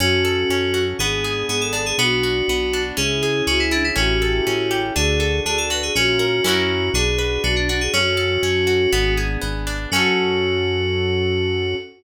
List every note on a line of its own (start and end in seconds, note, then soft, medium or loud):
0.00 0.45 F#2 medium
0.00 0.50 C#4 loud
0.00 0.98 C#4 medium
0.00 0.84 F#4 loud
0.00 0.98 F#4 medium
0.00 0.98 A4 medium
0.25 0.95 A4 medium
0.49 0.94 F#2 medium
0.49 0.98 C#4 medium
0.74 0.97 F#4 medium
0.99 1.44 G#1 medium
0.99 1.97 B3 medium
0.99 1.49 B3 loud
0.99 1.97 D4 medium
0.99 1.46 G#4 medium
0.99 1.97 G#4 medium
1.24 1.95 G#4 medium
1.49 1.93 G#1 medium
1.49 1.96 B3 medium
1.49 1.61 G#4 medium
1.61 1.73 A4 medium
1.73 1.96 D4 medium
1.73 1.85 A4 medium
1.86 1.98 G#4 medium
1.98 2.43 B1 medium
1.98 2.95 B3 medium
1.98 2.49 B3 loud
1.98 2.95 D4 medium
1.98 2.95 F#4 medium
1.98 2.82 F#4 loud
2.23 2.94 F#4 medium
2.48 2.92 B1 medium
2.48 2.96 B3 medium
2.73 2.97 D4 medium
2.97 3.42 C#2 medium
2.97 3.47 C#4 loud
2.97 3.95 C#4 medium
2.97 3.95 E4 medium
2.97 3.95 G#4 medium
2.97 3.42 G#4 medium
3.23 3.93 G#4 medium
3.47 3.92 C#2 medium
3.47 3.94 C#4 medium
3.47 3.59 F#4 loud
3.60 3.71 E4 medium
3.71 3.83 D4 medium
3.71 3.95 E4 medium
3.84 3.96 E4 medium
3.96 4.41 A1 medium
3.96 4.46 C#4 loud
3.96 4.93 C#4 medium
3.96 4.93 E4 medium
3.96 4.80 F#4 medium
3.96 4.93 G4 loud
3.96 4.93 A4 medium
4.22 4.92 A4 medium
4.46 4.91 A1 medium
4.46 4.94 C#4 medium
4.71 4.94 G4 medium
4.95 5.41 D2 loud
4.95 5.93 D4 medium
4.95 5.46 D4 loud
4.95 5.93 F#4 medium
4.95 5.40 G#4 loud
4.95 5.93 A4 medium
5.20 5.90 A4 medium
5.45 5.90 D2 medium
5.45 5.93 D4 medium
5.45 5.57 G#4 medium
5.58 5.70 A4 medium
5.70 5.94 F#4 medium
5.70 5.82 B4 medium
5.83 5.95 G#4 medium
5.95 6.41 A#1 medium
5.95 6.43 C#4 medium
5.95 6.43 C#4 loud
5.95 6.44 F4 medium
5.95 6.89 F#4 loud
5.95 6.43 A#4 medium
6.19 6.43 A#4 medium
6.44 6.90 F#2 loud
6.44 6.92 C#4 medium
6.44 6.89 C#4 loud
6.44 6.92 E4 medium
6.44 6.89 E4 loud
6.44 6.92 F#4 medium
6.44 6.89 F#4 loud
6.44 6.92 A#4 medium
6.48 6.89 A#4 loud
6.94 7.38 B1 medium
6.94 7.92 D4 medium
6.94 7.43 D4 loud
6.94 7.92 F#4 medium
6.94 7.42 G#4 medium
6.94 7.92 B4 medium
7.18 7.89 B4 medium
7.44 7.89 B1 medium
7.44 7.91 D4 medium
7.44 7.55 F#4 medium
7.56 7.68 D4 medium
7.69 7.80 D4 medium
7.69 7.93 F#4 medium
7.81 7.93 G#4 medium
7.93 8.38 F#2 medium
7.93 8.43 C#4 loud
7.93 8.91 C#4 medium
7.93 9.13 F#4 loud
7.93 8.91 F#4 medium
7.93 8.91 A4 medium
8.17 8.88 A4 medium
8.43 8.87 F#2 medium
8.43 8.90 C#4 medium
8.67 8.90 F#4 medium
8.92 9.37 G#1 loud
8.92 9.90 B3 medium
8.92 9.41 B3 loud
8.92 9.90 D4 medium
8.92 9.90 G#4 medium
9.17 9.88 G#4 medium
9.41 9.87 G#1 medium
9.41 9.89 B3 medium
9.67 9.90 D4 medium
9.92 11.75 F#2 loud
9.92 11.76 C#4 loud
9.92 11.74 F#4 loud
9.92 11.76 F#4 loud
9.92 11.76 F#4 medium
9.92 11.76 A4 loud
9.96 11.76 A4 medium